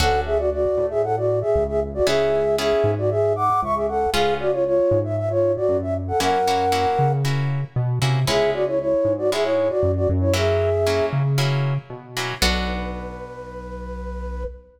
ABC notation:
X:1
M:4/4
L:1/16
Q:1/4=116
K:Bdor
V:1 name="Flute"
[Af]2 [Ge] [Fd] [Fd]3 [Ge] [Af] [Fd]2 [Ge]2 [Ge] z [Fd] | [Ge]4 [Ge]3 [Fd] [Ge]2 [fd']2 [ec'] [Ge] [Af]2 | [G^e]2 [Fd] [^Ec] [Ec]3 =e e [^Ec]2 [Fd]2 =e z [Af] | [^Af]8 z8 |
[Ge]2 [Fd] [Ec] [Ec]3 [Fd] [Ge] [Ec]2 [Fd]2 [Fd] z [Ec] | [Ge]6 z10 | B16 |]
V:2 name="Acoustic Guitar (steel)"
[CDFA]16 | [B,CEG]4 [B,CEG]12 | [B,C^EG]16 | [^A,CEF]2 [A,CEF]2 [A,CEF]4 [A,CEF]6 [A,CEF]2 |
[G,B,CE]8 [G,B,CE]8 | [F,^A,CE]4 [F,A,CE]4 [F,A,CE]6 [F,A,CE]2 | [B,DFA]16 |]
V:3 name="Synth Bass 1" clef=bass
D,,6 A,,6 C,,4 | C,,6 G,,6 C,,4 | C,,6 G,,6 F,,4 | F,,6 C,6 B,,2 =C,2 |
C,,6 G,,6 F,,2 F,,2- | F,,6 C,6 B,,4 | B,,,16 |]